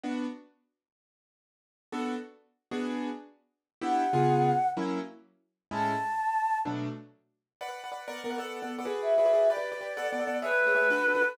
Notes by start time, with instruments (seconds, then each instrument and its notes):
0.04 acoustic grand piano B3 D4 F#4
1.92 acoustic grand piano B3 D4 F#4 A4
2.71 acoustic grand piano B3 D4 F#4 G#4
3.81 acoustic grand piano B3 D4 E4 G4, choir aahs F#5
4.13 acoustic grand piano C#3 B3 F4 G#4
4.77 acoustic grand piano F#3 A#3 C#4 E4
5.71 acoustic grand piano A2 G#3 C#4 E4, choir aahs A5
6.65 acoustic grand piano B2 F#3 A3 D4
7.61 acoustic grand piano B4 D5 F#5
7.68 acoustic grand piano B4 D5 F#5
7.84 acoustic grand piano B4 D5 F#5
7.92 acoustic grand piano B4 D5 F#5
8.08 acoustic grand piano B3 A#4 D5 F#5
8.24 acoustic grand piano B3 A#4 D5 F#5
8.30 acoustic grand piano B3 A#4 D5 F#5
8.38 acoustic grand piano B3 A4 D5 F#5
8.62 acoustic grand piano B3 A4 D5 F#5
8.78 acoustic grand piano B3 A4 D5 F#5
8.85 acoustic grand piano F#4 G#4 B4 D5
9.02 choir aahs E5
9.18 acoustic grand piano F#4 G#4 B4 D5
9.25 acoustic grand piano F#4 G#4 B4 D5
9.33 acoustic grand piano F#4 G#4 B4 D5
9.49 acoustic grand piano G4 B4 D5, choir aahs D5
9.57 acoustic grand piano G4 B4 D5
9.72 acoustic grand piano G4 B4 D5
9.81 acoustic grand piano G4 B4 D5
9.97 acoustic grand piano B3 A4 D5 F#5
10.12 acoustic grand piano B3 A4 D5 F#5
10.20 acoustic grand piano B3 A4 D5 F#5
10.27 acoustic grand piano B3 A4 D5 F#5
10.42 acoustic grand piano A3 G#4 C#5 E5, choir aahs B4
10.51 acoustic grand piano A3 G#4 C#5 E5
10.66 acoustic grand piano A3 G#4 C#5 E5
10.75 acoustic grand piano A3 G#4 C#5 E5
10.90 acoustic grand piano D4 F#4 A4 B4
11.08 acoustic grand piano D4 F#4 A4 B4
11.15 acoustic grand piano D4 F#4 A4 B4
11.22 acoustic grand piano D4 F#4 A4 B4